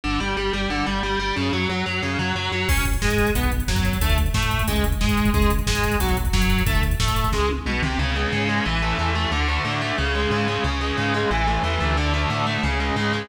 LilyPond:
<<
  \new Staff \with { instrumentName = "Overdriven Guitar" } { \time 4/4 \key fis \phrygian \tempo 4 = 181 d8 g8 g8 g8 d8 g8 g8 g8 | cis8 fis8 fis8 fis8 cis8 fis8 fis8 fis8 | \key cis \phrygian cis'8 r8 gis4 b8 r8 fis4 | a8 r8 a4 gis8 r8 gis4 |
gis8 r8 gis4 fis8 r8 fis4 | a8 r8 a4 gis8 r8 b,8 bis,8 | cis8 gis8 cis8 gis8 e8 a8 e8 a8 | d8 a8 d8 a8 cis8 gis8 cis8 gis8 |
cis8 gis8 cis8 gis8 e8 a8 e8 a8 | d8 a8 d8 a8 cis8 gis8 cis8 gis8 | }
  \new Staff \with { instrumentName = "Synth Bass 1" } { \clef bass \time 4/4 \key fis \phrygian g,,8 g,,8 g,,8 g,,8 g,,8 g,,8 g,,8 g,,8 | fis,8 fis,8 fis,8 fis,8 fis,8 fis,8 fis,8 fis,8 | \key cis \phrygian cis,4 gis,4 b,,4 fis,4 | d,4 a,4 cis,4 gis,4 |
cis,4 gis,4 b,,4 fis,4 | d,4 a,4 cis,4 b,,8 bis,,8 | cis,4 gis,4 a,,4 e,4 | d,4 a,4 cis,4 gis,4 |
cis,4 gis,4 a,,4 e,8 d,8~ | d,4 a,4 cis,4 gis,4 | }
  \new DrumStaff \with { instrumentName = "Drums" } \drummode { \time 4/4 r4 r4 r4 r4 | r4 r4 r4 r4 | <cymc bd>16 <hh bd>16 <hh bd>16 <hh bd>16 <bd sn>16 <hh bd>16 <hh bd>16 <hh bd>16 <hh bd>16 <hh bd>16 <hh bd>16 <hh bd>16 <bd sn>16 <hh bd>16 <hh bd>16 <hh bd>16 | <hh bd>16 <hh bd>16 <hh bd>16 <hh bd>16 <bd sn>16 <hh bd>16 <hh bd>16 <hh bd>16 <hh bd>16 <hh bd>16 <hh bd>16 <hh bd>16 <bd sn>16 <hh bd>16 <hh bd>16 <hh bd>16 |
<hh bd>16 <hh bd>16 <hh bd>16 <hh bd>16 <bd sn>16 <hh bd>16 <hh bd>16 <hh bd>16 <hh bd>16 <hh bd>16 <hh bd>16 <hh bd>16 <bd sn>16 <hh bd>16 <hh bd>16 <hh bd>16 | <hh bd>16 <hh bd>16 <hh bd>16 <hh bd>16 <bd sn>16 <hh bd>16 <hh bd>16 <hh bd>16 <bd sn>8 tommh8 toml8 tomfh8 | r4 r4 r4 r4 | r4 r4 r4 r4 |
r4 r4 r4 r4 | r4 r4 r4 r4 | }
>>